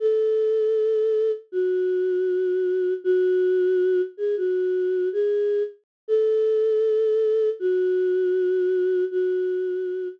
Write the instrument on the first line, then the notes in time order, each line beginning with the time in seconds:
choir aahs
0.00 A4
1.52 F#4
3.04 F#4
4.17 G#4
4.37 F#4
5.13 G#4
6.08 A4
7.59 F#4
9.11 F#4